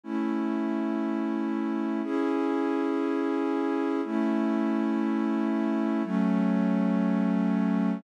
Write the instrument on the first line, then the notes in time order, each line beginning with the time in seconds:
pad 2 (warm)
0.03 A3 C#4 E4
2.03 C#4 E4 G#4
4.04 A3 C#4 E4
6.03 F#3 A3 C#4